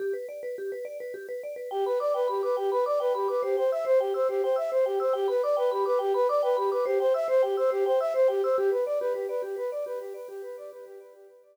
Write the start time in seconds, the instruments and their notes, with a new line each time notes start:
0.00 vibraphone G4
0.13 vibraphone B4
0.29 vibraphone D5
0.43 vibraphone B4
0.58 vibraphone G4
0.72 vibraphone B4
0.85 vibraphone D5
1.00 vibraphone B4
1.14 vibraphone G4
1.29 vibraphone B4
1.43 vibraphone D5
1.56 vibraphone B4
1.71 flute G4, vibraphone G5
1.86 flute B4, vibraphone B5
2.00 flute D5, vibraphone D6
2.14 flute B4, vibraphone G5
2.28 flute G4, vibraphone B5
2.43 flute B4, vibraphone D6
2.57 flute G4, vibraphone G5
2.71 flute B4, vibraphone B5
2.86 flute D5, vibraphone D6
3.00 flute B4, vibraphone G5
3.14 flute G4, vibraphone B5
3.28 flute B4, vibraphone D6
3.43 flute G4, vibraphone C5
3.57 flute C5, vibraphone G5
3.71 flute E5, vibraphone E6
3.85 vibraphone C5, flute C5
4.00 flute G4, vibraphone G5
4.14 flute C5, vibraphone E6
4.29 flute G4, vibraphone C5
4.43 flute C5, vibraphone G5
4.56 flute E5, vibraphone E6
4.71 flute C5, vibraphone C5
4.86 flute G4, vibraphone G5
5.00 flute C5, vibraphone E6
5.13 flute G4, vibraphone G5
5.28 flute B4, vibraphone B5
5.43 flute D5, vibraphone D6
5.57 flute B4, vibraphone G5
5.71 flute G4, vibraphone B5
5.86 flute B4, vibraphone D6
5.99 flute G4, vibraphone G5
6.14 flute B4, vibraphone B5
6.29 flute D5, vibraphone D6
6.43 flute B4, vibraphone G5
6.57 flute G4, vibraphone B5
6.71 flute B4, vibraphone D6
6.86 flute G4, vibraphone C5
7.00 flute C5, vibraphone G5
7.14 flute E5, vibraphone E6
7.28 vibraphone C5, flute C5
7.43 flute G4, vibraphone G5
7.57 flute C5, vibraphone E6
7.70 flute G4, vibraphone C5
7.86 flute C5, vibraphone G5
8.00 flute E5, vibraphone E6
8.14 vibraphone C5, flute C5
8.28 flute G4, vibraphone G5
8.43 flute C5, vibraphone E6
8.57 flute G4, vibraphone G4
8.71 vibraphone B4, flute B4
8.86 flute D5, vibraphone D5
9.00 vibraphone G4, flute B4
9.14 flute G4, vibraphone B4
9.29 flute B4, vibraphone D5
9.42 vibraphone G4, flute G4
9.56 vibraphone B4, flute B4
9.71 flute D5, vibraphone D5
9.86 vibraphone G4, flute B4
10.00 flute G4, vibraphone B4
10.14 flute B4, vibraphone D5
10.28 vibraphone G4, flute G4
10.42 vibraphone B4, flute B4
10.57 flute D5, vibraphone D5
10.71 vibraphone G4, flute B4
10.86 flute G4, vibraphone B4
11.00 flute B4, vibraphone D5
11.13 vibraphone G4, flute G4
11.29 flute B4, vibraphone B4
11.43 flute D5, vibraphone D5